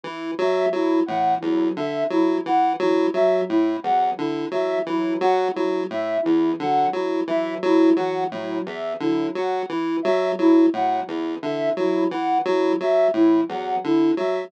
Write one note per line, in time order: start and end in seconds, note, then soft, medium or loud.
0.03 0.31 E3 medium
0.03 0.31 E4 medium
0.38 0.66 F#3 medium
0.38 0.68 E5 medium
0.73 1.00 F#3 medium
0.73 1.00 E4 medium
1.06 1.35 A2 medium
1.06 1.35 E3 medium
1.06 1.34 F#5 medium
1.40 1.69 E2 medium
1.40 1.70 F#3 medium
1.40 1.68 E4 medium
1.76 2.04 D3 medium
1.76 2.04 E5 medium
2.10 2.38 F#3 medium
2.10 2.38 E4 medium
2.46 2.73 E3 medium
2.46 2.74 F#5 medium
2.79 3.07 E3 medium
2.79 3.07 F#3 medium
2.79 3.08 E4 medium
3.14 3.41 F#3 medium
3.14 3.42 F#3 medium
3.14 3.42 E5 medium
3.49 3.77 A2 medium
3.49 3.76 E4 medium
3.83 4.11 E2 medium
3.83 4.11 F#3 medium
3.83 4.11 F#5 medium
4.17 4.46 D3 medium
4.17 4.45 E4 medium
4.51 4.79 E3 medium
4.51 4.79 F#3 medium
4.51 4.80 E5 medium
4.86 5.14 E3 medium
4.86 5.15 F#3 medium
4.86 5.15 E4 medium
5.21 5.48 F#3 medium
5.21 5.48 F#5 medium
5.53 5.84 F#3 medium
5.53 5.81 E4 medium
5.90 6.18 A2 medium
5.90 6.20 E5 medium
6.22 6.53 E2 medium
6.22 6.52 E3 medium
6.22 6.50 E4 medium
6.59 6.87 D3 medium
6.59 6.86 F#3 medium
6.59 6.89 F#5 medium
6.93 7.21 F#3 medium
6.93 7.21 E4 medium
7.27 7.55 E3 medium
7.27 7.55 F#3 medium
7.27 7.56 E5 medium
7.63 7.90 F#3 medium
7.63 7.92 E4 medium
7.96 8.25 E3 medium
7.96 8.24 F#3 medium
7.96 8.24 F#5 medium
8.30 8.59 A2 medium
8.30 8.60 F#3 medium
8.30 8.58 E4 medium
8.66 8.94 E2 medium
8.66 8.94 E5 medium
9.00 9.28 D3 medium
9.00 9.28 F#3 medium
9.00 9.27 E4 medium
9.35 9.63 F#3 medium
9.35 9.64 F#5 medium
9.69 9.97 E3 medium
9.69 9.97 E4 medium
10.02 10.32 F#3 medium
10.02 10.30 E5 medium
10.39 10.66 F#3 medium
10.39 10.66 E4 medium
10.73 11.01 A2 medium
10.73 11.01 F#3 medium
10.73 11.01 F#5 medium
11.06 11.35 E2 medium
11.06 11.34 E4 medium
11.42 11.70 D3 medium
11.42 11.70 E3 medium
11.42 11.70 E5 medium
11.76 12.04 F#3 medium
11.76 12.05 E4 medium
12.11 12.39 E3 medium
12.11 12.39 F#5 medium
12.45 12.73 F#3 medium
12.45 12.74 E4 medium
12.80 13.08 F#3 medium
12.80 13.09 E5 medium
13.14 13.41 A2 medium
13.14 13.42 E3 medium
13.14 13.42 E4 medium
13.48 13.76 E2 medium
13.48 13.76 F#3 medium
13.48 13.76 F#5 medium
13.84 14.12 D3 medium
13.84 14.11 E4 medium
14.17 14.45 F#3 medium
14.17 14.46 F#3 medium
14.17 14.45 E5 medium